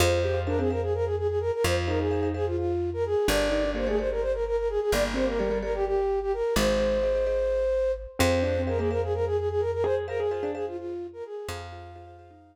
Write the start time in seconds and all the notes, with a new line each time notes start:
0.00 F2 F4 G#4 C5 F5
0.23 G4 G#4 C5 F5
0.34 F4
0.47 D4 G#4 A#4 C5 F5
0.59 C4 G#4 C5 F5
0.70 G#4 A#4 C5 F5
0.82 G#4
0.94 A#4
1.05 G#4
1.18 G#4
1.28 G#4
1.40 A#4
1.53 A#4
1.64 F2 F4 C5
1.88 D#4 G#4 A#4 C5 F5
1.99 D#4 G#4
2.11 G#4 C5 F5
2.23 G#4 C5 F5
2.34 G#4 C5 F5
2.46 F4
2.57 F4
2.93 A#4
3.06 G#4
3.28 G1 D4 G4 A4 A#4 D5
3.50 D#4 G4 A4 A#4 D5
3.64 D4
3.75 A#3 G4 A4 A#4 C5 D5
3.87 A3 G4 G#4 A4 A#4 D5
3.98 G4 A4 A#4 C5 D5
4.11 A#4
4.21 C5
4.33 A#4
4.46 A#4
4.57 A#4
4.69 G#4
4.81 G#4
4.92 G1 A#3 D5
5.14 C4 G4 A4 A#4 C5 D5
5.26 A#3 A#4
5.39 G3 G4 A4 A#4 D5
5.50 G3 G4 A4 A#4 D5
5.62 G4 A4 A#4 D5
5.74 G4
5.86 G4
6.21 G4
6.33 A#4
6.56 G#1 G#3 G#4 C5 D#5
6.80 G#4 C5 D#5
7.03 G#4 C5 D#5
7.15 G#4 C5 D#5
7.27 G#4 C5 D#5
8.19 F2 C4 G#4 C5 F5
8.42 D4 G#4 C5 F5
8.57 C4
8.67 G#3 G#4 A#4 C5 F5
8.79 A#3 G#4 C5 F5
8.90 G#4 A#4 C5 F5
9.03 G#4
9.14 A#4
9.26 G#4
9.38 G#4
9.50 G#4
9.60 A#4
9.73 A#4
9.84 G#4 C5
10.08 G#4 A#4 C5 F5
10.19 G#4
10.31 F4 G#4 C5 F5
10.43 D4 G#4 C5 F5
10.54 G#4 C5 F5
10.67 F4
10.77 F4
11.13 A#4
11.25 G#4
11.48 F2 G#4 C5 F5
11.72 F4 G#4 C5 F5
11.95 F4 G#4 C5 F5
12.07 G#4 C5 F5
12.19 G#4 C5 F5
12.31 D#4